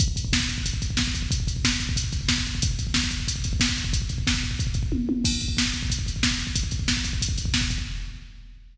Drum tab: CC |----------------|----------------|----------------|----------------|
HH |x-x---x-x-x---x-|x-x---x-x-x---x-|x-x---x-x-x---x-|x-x-----x-x-----|
SD |----o-------o---|----o-------o---|----o-------o---|----o-----------|
T1 |----------------|----------------|----------------|------------o-o-|
BD |oooooooooooooooo|oooooooooooooooo|oooooooooooooooo|ooooooooooooo---|

CC |x---------------|----------------|
HH |--x---x-x-x---x-|x-x---x-x-x---x-|
SD |----o-------o---|----o-------o---|
T1 |----------------|----------------|
BD |oooooooooooooooo|oooooooooooooooo|